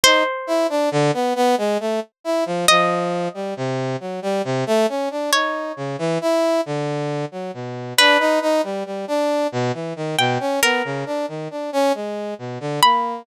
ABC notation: X:1
M:6/8
L:1/16
Q:3/8=45
K:none
V:1 name="Orchestral Harp"
c12 | _e12 | _d12 | B10 g2 |
_B10 =b2 |]
V:2 name="Brass Section"
_E z =E D D, B, B, _A, =A, z E F, | F,3 G, C,2 _G, =G, C, A, _D =D | _E2 _D, =E, =E2 =D,3 _G, B,,2 | D _E E G, G, D2 B,, =E, _E, B,, _D |
B, _D, =D _E, D _D _A,2 B,, =D, _B,2 |]